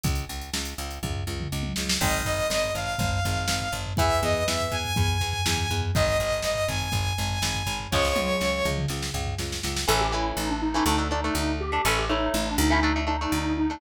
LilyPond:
<<
  \new Staff \with { instrumentName = "Lead 2 (sawtooth)" } { \time 4/4 \key aes \mixolydian \tempo 4 = 122 r1 | ees''8 ees''8 ees''8 f''2~ f''8 | fes''8 ees''8 fes''8 aes''2~ aes''8 | ees''8 ees''8 ees''8 aes''2~ aes''8 |
des''2 r2 | \key a \mixolydian r1 | r1 | }
  \new Staff \with { instrumentName = "Lead 1 (square)" } { \time 4/4 \key aes \mixolydian r1 | r1 | r1 | r1 |
r1 | \key a \mixolydian a'16 g'16 e'8 ees'16 d'16 dis'4 dis'4 g'8 | a'16 g'16 dis'8 ees'16 d'16 dis'4 dis'4 dis'8 | }
  \new Staff \with { instrumentName = "Overdriven Guitar" } { \time 4/4 \key aes \mixolydian r1 | <ees aes>1 | <fes ces'>1 | <ees aes>1 |
<des f aes>1 | \key a \mixolydian <e a cis'>8 <e a cis'>4~ <e a cis'>16 <e a cis'>16 <a d'>16 <a d'>16 <a d'>16 <a d'>4 <a d'>16 | <a cis' e'>8 <a cis' e'>4~ <a cis' e'>16 <a cis' e'>16 <a d'>16 <a d'>16 <a d'>16 <a d'>4 <a d'>16 | }
  \new Staff \with { instrumentName = "Electric Bass (finger)" } { \clef bass \time 4/4 \key aes \mixolydian des,8 des,8 des,8 des,8 des,8 des,8 des,8 des,8 | aes,,8 aes,,8 aes,,8 aes,,8 aes,,8 aes,,8 aes,,8 aes,,8 | fes,8 fes,8 fes,8 fes,8 fes,8 fes,8 fes,8 fes,8 | aes,,8 aes,,8 aes,,8 aes,,8 aes,,8 aes,,8 aes,,8 aes,,8 |
des,8 des,8 des,8 des,8 des,8 des,8 des,8 des,8 | \key a \mixolydian a,,4 a,,4 d,4 d,4 | a,,4 a,,8 d,4. d,4 | }
  \new DrumStaff \with { instrumentName = "Drums" } \drummode { \time 4/4 <hh bd>16 hh16 hh16 hh16 sn16 hh16 hh16 hh16 <bd tomfh>16 tomfh8 toml16 r16 tommh16 sn16 sn16 | <cymc bd>16 tomfh16 tomfh16 tomfh16 sn16 tomfh16 tomfh16 tomfh16 <bd tomfh>16 tomfh16 tomfh16 tomfh16 sn16 tomfh16 tomfh16 tomfh16 | <bd tomfh>16 tomfh16 tomfh16 tomfh16 sn16 tomfh16 tomfh16 tomfh16 <bd tomfh>16 tomfh16 tomfh16 tomfh16 sn16 tomfh16 tomfh16 tomfh16 | <bd tomfh>16 tomfh16 tomfh16 tomfh16 sn16 tomfh16 tomfh16 tomfh16 <bd tomfh>16 tomfh16 tomfh16 tomfh16 sn16 tomfh16 tomfh16 tomfh16 |
<bd sn>16 sn16 tommh8 sn8 toml16 toml16 sn16 sn16 tomfh16 tomfh16 sn16 sn16 sn16 sn16 | r4 r4 r4 r4 | r4 r4 r4 r4 | }
>>